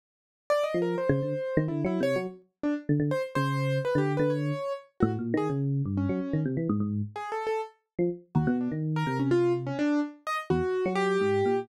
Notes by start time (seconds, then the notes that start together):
0.50 D5
0.63 D#5
0.74 F3
0.82 A#4
0.98 C5
1.09 C#3
1.22 D3
1.57 D#3
1.68 D3 E4
1.85 F#3 E4
2.00 C3 C#5
2.16 F#3
2.63 D4
2.89 D3
3.00 D3
3.11 C5
3.35 C#3 C5
3.85 B4
3.95 D3 G4
4.17 D3 B4
4.30 C#5
5.00 A2 F#4
5.19 A#2
5.34 D#3 G#4
5.50 C#3
5.85 G2
5.97 C#4
6.09 F#3
6.33 D#3
6.45 C3
6.57 E3
6.69 G#2
6.80 G#2
7.16 G#4
7.32 A4
7.47 A4
7.99 F3
8.35 D#2 F#4
8.47 B2
8.61 D4
8.72 D#3
8.96 A#4
9.07 C3
9.19 C#4
9.31 F4
9.66 C#4
9.79 D4
10.27 D#5
10.50 E2 F#4
10.86 F#3
10.95 G4
11.21 G#2
11.45 A#2